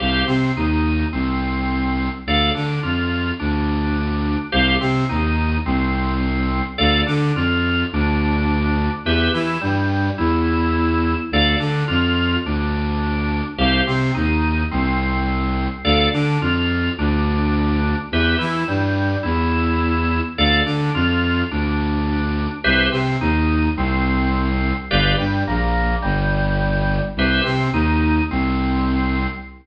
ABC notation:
X:1
M:4/4
L:1/8
Q:1/4=106
K:C
V:1 name="Drawbar Organ"
[Gcf] C ^D2 C4 | [Adf] D F2 D4 | [Gcf] C ^D2 C4 | [Adf] D F2 D4 |
[GBe] E G,2 E4 | [Adf] D F2 D4 | [Gcf] C ^D2 C4 | [Adf] D F2 D4 |
[GBe] E G,2 E4 | [Adf] D F2 D4 | [GBce] C ^D2 C4 | [GBdf] G, ^A,2 G,4 |
[GBce] C ^D2 C4 |]
V:2 name="Violin" clef=bass
C,, C, ^D,,2 C,,4 | D,, D, F,,2 D,,4 | C,, C, ^D,,2 C,,4 | D,, D, F,,2 D,,4 |
E,, E, G,,2 E,,4 | D,, D, F,,2 D,,4 | C,, C, ^D,,2 C,,4 | D,, D, F,,2 D,,4 |
E,, E, G,,2 E,,4 | D,, D, F,,2 D,,4 | C,, C, ^D,,2 C,,4 | G,,, G,, ^A,,,2 G,,,4 |
C,, C, ^D,,2 C,,4 |]